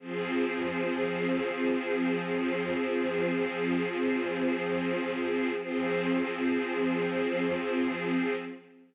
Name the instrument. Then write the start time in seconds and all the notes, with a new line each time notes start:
string ensemble 1
0.00 F3 C4 G#4
5.58 F3 C4 G#4